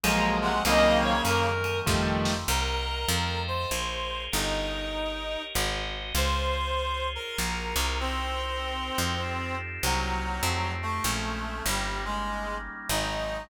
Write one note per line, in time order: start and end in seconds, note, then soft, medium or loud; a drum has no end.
0.04 0.61 A#1 medium
0.04 0.64 F3 medium
0.04 0.51 F3 loud
0.04 0.64 F#3 medium
0.04 0.51 F#3 loud
0.04 0.64 G#3 medium
0.04 0.51 G#3 loud
0.04 0.64 A#3 medium
0.04 0.51 A#3 loud
0.04 0.37 A#5 medium
0.04 ride loud
0.42 0.62 C3 medium
0.42 0.62 G#3 medium
0.42 0.63 F#5 medium
0.65 1.21 C2 medium
0.65 1.50 C#3 loud
0.65 1.87 D#3 medium
0.65 1.14 D#3 loud
0.65 1.87 F#3 loud
0.65 1.14 F#3 loud
0.65 1.50 A#3 loud
0.65 1.87 A#3 medium
0.65 1.14 A#3 loud
0.65 1.87 C4 medium
0.65 1.14 C4 loud
0.65 0.98 D#5 medium
0.65 ride loud
1.03 1.22 C#5 medium
1.25 1.81 F#2 medium
1.25 1.80 A#4 medium
1.25 hi-hat pedal medium
1.25 ride medium
1.64 ride medium
1.86 2.45 F2 medium
1.86 2.34 D#3 loud
1.86 2.48 D#3 medium
1.86 2.34 F3 loud
1.86 2.48 F3 medium
1.86 2.34 G3 loud
1.86 2.48 G3 medium
1.86 2.34 A3 loud
1.86 2.48 A3 medium
1.86 kick medium
1.86 snare medium
2.25 snare medium
2.48 3.06 C2 loud
2.48 3.09 A#4 medium
2.48 3.41 A#4 medium
2.48 3.09 C5 medium
2.48 3.09 D#5 medium
2.48 3.09 F#5 medium
3.09 3.66 F2 loud
3.09 3.70 A4 medium
3.09 3.70 D#5 medium
3.09 3.70 F5 medium
3.09 3.70 G5 medium
3.48 4.22 C5 medium
3.71 4.29 A#1 medium
3.71 4.32 G#4 medium
3.71 4.32 A#4 medium
3.71 4.32 C5 medium
3.71 4.32 C#5 medium
4.32 5.37 G1 medium
4.32 5.42 D#4 medium
4.32 5.54 G4 medium
4.32 5.54 A#4 medium
4.32 5.54 C#5 medium
4.32 5.54 D#5 medium
5.54 6.13 G#1 medium
5.54 6.15 F#4 medium
5.54 6.15 G#4 medium
5.54 6.15 C5 medium
5.54 6.15 D#5 medium
6.15 7.18 C#2 medium
6.15 7.38 F4 medium
6.15 7.38 G#4 medium
6.15 7.07 C5 loud
6.15 7.38 C5 medium
6.15 7.38 C#5 medium
7.15 7.98 A#4 medium
7.38 7.74 A#1 medium
7.38 7.99 F4 medium
7.38 7.99 F#4 medium
7.38 7.99 G#4 medium
7.38 7.99 A#4 medium
7.76 8.91 C2 medium
8.00 9.55 C4 loud
8.00 9.22 D#4 medium
8.00 9.22 F#4 medium
8.00 9.22 A#4 medium
8.00 9.22 C5 medium
8.98 9.79 F2 medium
9.22 9.83 D#4 medium
9.22 9.83 F4 medium
9.22 9.83 G4 medium
9.22 9.83 A4 medium
9.83 10.41 C2 medium
9.83 10.72 F#3 loud
9.83 10.45 A#3 medium
9.83 10.45 C4 medium
9.83 10.44 D#4 medium
9.83 10.45 F#4 medium
10.43 11.00 F2 medium
10.43 11.05 A3 medium
10.43 11.05 D#4 medium
10.43 11.05 F4 medium
10.43 11.05 G4 medium
10.82 11.63 A3 medium
11.04 11.62 A#1 medium
11.04 11.66 G#3 medium
11.04 11.66 A#3 medium
11.04 11.66 C4 medium
11.04 11.66 C#4 loud
11.66 12.69 G1 medium
11.66 12.02 G3 medium
11.66 12.89 G3 loud
11.66 12.89 A#3 medium
11.66 12.89 C#4 medium
11.66 12.89 D#4 medium
12.05 12.56 G#3 medium
12.89 13.47 G#1 medium
12.89 13.49 F#3 medium
12.89 13.49 G#3 medium
12.89 13.49 C4 medium
12.89 13.43 D#4 medium
12.89 13.49 D#4 medium